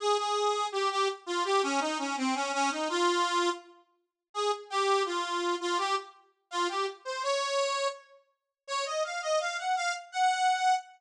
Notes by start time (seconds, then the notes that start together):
0.00 G#4
0.18 G#4
0.72 G4
0.91 G4
1.26 F4
1.44 G4
1.63 C#4
1.81 D#4
1.99 C#4
2.17 C4
2.35 C#4
2.53 C#4
2.71 D#4
2.89 F4
4.34 G#4
4.70 G4
5.06 F4
5.60 F4
5.78 G4
6.51 F4
6.69 G4
7.05 C5
7.23 C#5
8.67 C#5
8.86 D#5
9.04 F5
9.22 D#5
9.40 F5
9.58 F#5
9.76 F5
10.12 F#5